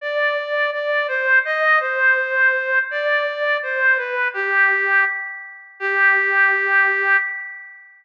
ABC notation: X:1
M:2/4
L:1/8
Q:1/4=83
K:G
V:1 name="Clarinet"
d2 d c | _e c3 | d2 c B | G2 z2 |
G4 |]